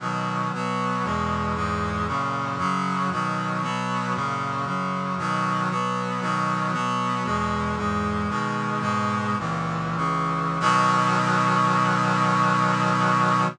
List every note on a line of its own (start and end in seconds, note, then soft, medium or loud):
0.00 0.51 B2 medium
0.00 0.51 D#3 medium
0.00 0.51 F#3 medium
0.53 1.03 B2 medium
0.53 1.04 F#3 medium
0.53 1.04 B3 medium
1.04 1.54 E2 medium
1.04 1.55 B2 medium
1.04 1.54 G#3 medium
1.55 2.06 E2 medium
1.55 2.06 G#2 medium
1.55 2.06 G#3 medium
2.07 2.58 F#2 medium
2.07 2.58 A#2 medium
2.07 2.58 C#3 medium
2.58 3.09 F#2 medium
2.58 3.09 C#3 medium
2.58 3.09 F#3 medium
3.11 3.62 B2 medium
3.11 3.62 D#3 medium
3.11 3.62 F#3 medium
3.62 4.13 B2 medium
3.62 4.13 F#3 medium
3.62 4.13 B3 medium
4.15 4.65 F#2 medium
4.15 4.66 A#2 medium
4.15 4.65 C#3 medium
4.65 5.16 F#2 medium
4.65 5.16 C#3 medium
4.65 5.16 F#3 medium
5.18 5.69 B2 medium
5.18 5.69 D#3 medium
5.18 5.69 F#3 medium
5.70 6.20 B2 medium
5.70 6.20 F#3 medium
5.70 6.21 B3 medium
6.21 6.72 B2 medium
6.21 6.72 D#3 medium
6.21 6.72 F#3 medium
6.72 7.24 B2 medium
6.72 7.24 F#3 medium
6.72 7.24 B3 medium
7.24 7.76 E2 medium
7.24 7.76 B2 medium
7.24 7.76 G#3 medium
7.77 8.28 E2 medium
7.77 8.28 G#2 medium
7.77 8.28 G#3 medium
8.29 8.80 B2 medium
8.29 8.81 D#3 medium
8.29 8.80 G#3 medium
8.80 9.36 G#2 medium
8.80 9.36 B2 medium
8.80 9.36 G#3 medium
9.38 9.95 C#2 medium
9.38 9.97 A#2 medium
9.38 9.95 E3 medium
9.96 10.58 C#2 medium
9.96 10.58 C#3 medium
9.96 10.58 E3 medium
10.60 13.45 B2 loud
10.60 13.45 D#3 loud
10.60 13.45 F#3 loud